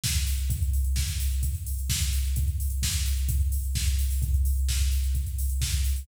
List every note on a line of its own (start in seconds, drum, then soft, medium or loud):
0.04 kick medium
0.04 snare loud
0.16 closed hi-hat medium
0.27 open hi-hat medium
0.37 closed hi-hat medium
0.50 kick loud
0.50 closed hi-hat loud
0.62 closed hi-hat medium
0.73 open hi-hat medium
0.84 closed hi-hat medium
0.96 kick medium
0.96 snare loud
1.08 closed hi-hat medium
1.20 open hi-hat medium
1.32 closed hi-hat medium
1.43 kick medium
1.43 closed hi-hat loud
1.55 closed hi-hat medium
1.66 open hi-hat medium
1.79 closed hi-hat medium
1.90 kick medium
1.90 snare loud
2.02 closed hi-hat medium
2.13 open hi-hat medium
2.25 closed hi-hat medium
2.36 kick loud
2.36 closed hi-hat loud
2.48 closed hi-hat medium
2.60 open hi-hat medium
2.70 closed hi-hat medium
2.82 kick medium
2.82 snare loud
2.94 closed hi-hat medium
3.06 open hi-hat medium
3.17 closed hi-hat medium
3.29 kick loud
3.29 closed hi-hat loud
3.41 closed hi-hat medium
3.52 open hi-hat medium
3.64 closed hi-hat medium
3.75 kick medium
3.75 snare loud
3.88 closed hi-hat medium
3.99 open hi-hat medium
4.10 open hi-hat medium
4.22 kick loud
4.22 closed hi-hat loud
4.34 closed hi-hat medium
4.45 open hi-hat medium
4.57 closed hi-hat medium
4.69 kick medium
4.69 snare loud
4.80 closed hi-hat medium
4.91 open hi-hat medium
5.04 closed hi-hat medium
5.15 kick medium
5.15 closed hi-hat medium
5.26 closed hi-hat medium
5.38 open hi-hat medium
5.50 closed hi-hat medium
5.61 kick medium
5.61 snare loud
5.73 closed hi-hat medium
5.84 open hi-hat medium
5.96 open hi-hat medium